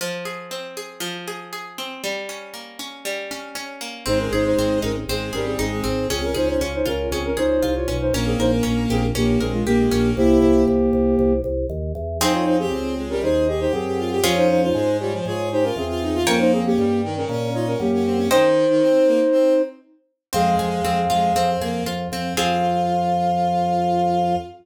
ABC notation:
X:1
M:4/4
L:1/16
Q:1/4=118
K:Fm
V:1 name="Flute"
z16 | z16 | [Ec] [DB] [Ec] [Ec]3 [DB] z [CA]2 [DB] [CA] [CA]4 | [CA] [DB] [Ec] [Ec] [Fd] [Ec] [DB]2 [CA] [DB] [Ec]3 [Fd]2 [Ec] |
[DB] [CA] [Ec] [DB]3 [CA] z [B,G]2 [CA] [A,F] [B,G]4 | [B,G]10 z6 | [Ec] [Fd] [Ec] [CA]3 z [DB] [Ec]2 [Ge] [Ec] [CA]4 | [Fd] [Ec] [Ec] [Ec]3 [Fd] z [Fd]2 [Ec] [DB] [CA]4 |
[DB] [Ec] [CA] [B,G]3 z [DB] [DB]2 [Fd] [DB] [B,G]4 | [Ec]12 z4 | [Af]10 z6 | f16 |]
V:2 name="Violin"
z16 | z16 | A,8 A,2 G,2 A, A, C2 | D4 z12 |
B,8 B,2 A,2 B, A, B,2 | =E4 z12 | E3 G C2 A, G, A2 A G2 G F G | D3 F A,2 G, F, A2 G F2 F E F |
B,3 D G,2 E, D, D2 E D2 D C D | E,3 E, C2 B, z C2 z6 | A,4 A, z A,2 C2 B,2 z2 C2 | F16 |]
V:3 name="Orchestral Harp"
F,2 A2 C2 A2 F,2 A2 A2 C2 | G,2 D2 B,2 D2 G,2 D2 D2 B,2 | C2 A2 C2 E2 C2 A2 E2 C2 | D2 A2 D2 F2 D2 A2 F2 D2 |
D2 B2 D2 G2 D2 B2 G2 D2 | z16 | [CEA]16 | [DFA]16 |
[dgb]16 | [ceg]16 | C2 A2 C2 F2 C2 A2 F2 C2 | [CFA]16 |]
V:4 name="Drawbar Organ" clef=bass
z16 | z16 | A,,,2 A,,,2 A,,,2 A,,,2 A,,,2 A,,,2 A,,,2 A,,,2 | D,,2 D,,2 D,,2 D,,2 D,,2 D,,2 C,,2 =B,,,2 |
B,,,2 B,,,2 B,,,2 B,,,2 B,,,2 B,,,2 B,,,2 B,,,2 | C,,2 C,,2 C,,2 C,,2 C,,2 C,,2 E,,2 =E,,2 | F,,4 D,,4 E,,4 _G,,4 | F,,4 A,,4 A,,4 =E,,4 |
F,,4 G,,4 B,,4 _G,,4 | z16 | F,,2 F,,2 F,,2 F,,2 F,,2 F,,2 F,,2 F,,2 | F,,16 |]